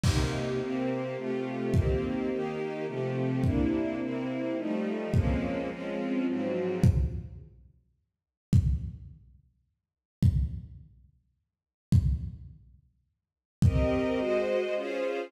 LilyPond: <<
  \new Staff \with { instrumentName = "String Ensemble 1" } { \time 3/4 \key c \phrygian \tempo 4 = 106 <c bes ees' g'>4 <c bes c' g'>4 <c a f' g'>4 | <ees bes c' g'>4 <ees bes ees' g'>4 <c f a g'>4 | <c bes d' e'>4 <c bes c' e'>4 <f g a ees'>4 | <f aes bes c' des'>4 <f aes c' des' f'>4 <aes, f ges c'>4 |
\key d \phrygian r2. | r2. | r2. | r2. |
\key c \phrygian <c' g' bes' ees''>4 <aes ges' c'' ees''>4 <des' f' aes' c''>4 | }
  \new DrumStaff \with { instrumentName = "Drums" } \drummode { \time 3/4 <cymc bd>4 r4 r4 | bd4 r4 r4 | bd4 r4 r4 | bd4 r4 r4 |
bd4 r4 r4 | bd4 r4 r4 | bd4 r4 r4 | bd4 r4 r4 |
bd4 r4 r4 | }
>>